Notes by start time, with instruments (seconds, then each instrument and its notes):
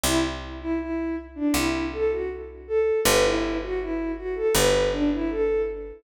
0.04 electric bass (finger) C2, violin E4
0.61 violin E4
0.79 violin E4
1.35 violin D4
1.54 electric bass (finger) C2, violin E4
1.93 violin A4
2.11 violin F#4
2.68 violin A4
3.05 electric bass (finger) G1, violin B4
3.24 violin E4
3.62 violin F#4
3.80 violin E4
4.17 violin F#4
4.35 violin A4
4.54 electric bass (finger) G1, violin B4
4.92 violin D4
5.12 violin E4
5.30 violin A4